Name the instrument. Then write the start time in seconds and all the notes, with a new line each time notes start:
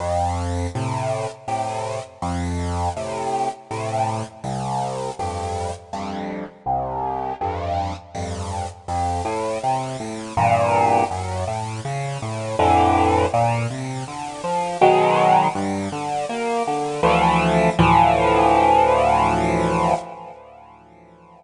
acoustic grand piano
0.00 F2
0.75 A2 C3
1.48 A2 C3
2.22 F2
2.97 A2 C3
3.71 A2 C3
4.44 C2
5.19 F2 G2
5.93 F2 G2
6.66 C2
7.41 F2 G2
8.15 F2 G2
8.88 F2
9.25 A2
9.63 C3
10.00 A2
10.37 E2 G2 A#2
11.11 F#2
11.47 A2
11.85 C#3
12.22 A2
12.59 F2 A2 D3 E3
13.34 A#2
13.70 C3
14.08 D3
14.44 F3
14.81 B2 D#3 F#3 G#3
15.55 G2
15.92 D3
16.29 A#3
16.67 D3
17.03 D2 E3 F3 A3
17.79 D2 A2 E3 F3